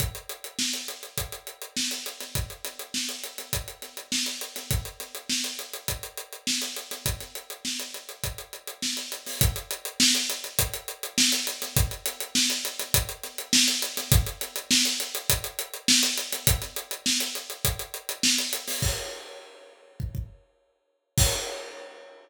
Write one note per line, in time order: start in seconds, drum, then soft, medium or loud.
0.00 kick medium
0.00 closed hi-hat medium
0.15 closed hi-hat medium
0.29 closed hi-hat medium
0.44 closed hi-hat medium
0.59 snare medium
0.73 closed hi-hat medium
0.88 closed hi-hat medium
1.03 closed hi-hat soft
1.18 kick medium
1.18 closed hi-hat medium
1.32 closed hi-hat medium
1.47 closed hi-hat medium
1.62 closed hi-hat medium
1.77 snare medium
1.91 closed hi-hat medium
2.06 closed hi-hat medium
2.20 snare soft
2.20 closed hi-hat medium
2.35 kick medium
2.35 closed hi-hat medium
2.50 closed hi-hat soft
2.65 snare soft
2.65 closed hi-hat medium
2.79 closed hi-hat medium
2.94 snare medium
3.09 closed hi-hat medium
3.24 closed hi-hat medium
3.38 snare soft
3.38 closed hi-hat medium
3.53 kick medium
3.53 closed hi-hat medium
3.68 closed hi-hat medium
3.82 snare soft
3.82 closed hi-hat soft
3.97 closed hi-hat medium
4.12 snare medium
4.26 closed hi-hat medium
4.41 closed hi-hat medium
4.56 snare soft
4.56 closed hi-hat medium
4.71 kick medium
4.71 closed hi-hat medium
4.85 closed hi-hat medium
5.00 snare soft
5.00 closed hi-hat medium
5.15 closed hi-hat medium
5.29 snare medium
5.44 closed hi-hat medium
5.59 closed hi-hat medium
5.74 closed hi-hat medium
5.88 kick medium
5.88 closed hi-hat medium
6.03 closed hi-hat medium
6.18 closed hi-hat medium
6.33 closed hi-hat soft
6.47 snare medium
6.62 closed hi-hat medium
6.76 closed hi-hat medium
6.91 snare soft
6.91 closed hi-hat medium
7.06 kick medium
7.06 closed hi-hat medium
7.20 snare soft
7.20 closed hi-hat soft
7.35 closed hi-hat medium
7.50 closed hi-hat medium
7.65 snare medium
7.80 closed hi-hat medium
7.94 closed hi-hat medium
8.09 closed hi-hat soft
8.24 kick medium
8.24 closed hi-hat medium
8.38 closed hi-hat medium
8.53 closed hi-hat soft
8.67 closed hi-hat medium
8.82 snare medium
8.97 closed hi-hat medium
9.12 closed hi-hat medium
9.26 snare soft
9.26 open hi-hat medium
9.41 kick loud
9.41 closed hi-hat loud
9.56 closed hi-hat medium
9.71 closed hi-hat medium
9.85 closed hi-hat medium
10.00 snare loud
10.15 closed hi-hat medium
10.30 closed hi-hat medium
10.44 closed hi-hat medium
10.59 kick medium
10.59 closed hi-hat loud
10.74 closed hi-hat medium
10.88 closed hi-hat medium
11.03 closed hi-hat medium
11.18 snare loud
11.32 closed hi-hat medium
11.47 closed hi-hat medium
11.62 snare soft
11.62 closed hi-hat medium
11.76 kick loud
11.76 closed hi-hat medium
11.91 closed hi-hat medium
12.06 snare soft
12.06 closed hi-hat medium
12.20 closed hi-hat medium
12.35 snare loud
12.50 closed hi-hat medium
12.65 closed hi-hat medium
12.79 snare soft
12.79 closed hi-hat medium
12.94 kick medium
12.94 closed hi-hat loud
13.09 closed hi-hat medium
13.24 snare soft
13.24 closed hi-hat medium
13.38 closed hi-hat medium
13.53 snare loud
13.68 closed hi-hat medium
13.82 closed hi-hat medium
13.97 snare medium
13.97 closed hi-hat medium
14.12 kick loud
14.12 closed hi-hat loud
14.26 closed hi-hat medium
14.41 snare soft
14.41 closed hi-hat medium
14.56 closed hi-hat medium
14.71 snare loud
14.85 closed hi-hat medium
15.00 closed hi-hat medium
15.15 closed hi-hat medium
15.30 kick medium
15.30 closed hi-hat loud
15.44 closed hi-hat medium
15.59 closed hi-hat medium
15.74 closed hi-hat medium
15.88 snare loud
16.03 closed hi-hat medium
16.18 closed hi-hat medium
16.32 snare soft
16.32 closed hi-hat medium
16.47 kick loud
16.47 closed hi-hat loud
16.62 snare soft
16.62 closed hi-hat medium
16.76 closed hi-hat medium
16.91 closed hi-hat medium
17.06 snare loud
17.20 closed hi-hat medium
17.35 closed hi-hat medium
17.50 closed hi-hat medium
17.65 kick medium
17.65 closed hi-hat medium
17.79 closed hi-hat medium
17.94 closed hi-hat medium
18.09 closed hi-hat medium
18.23 snare loud
18.38 closed hi-hat medium
18.53 closed hi-hat medium
18.68 snare medium
18.68 open hi-hat medium
18.82 kick medium
18.82 crash medium
20.00 kick medium
20.15 kick medium
21.18 kick loud
21.18 crash loud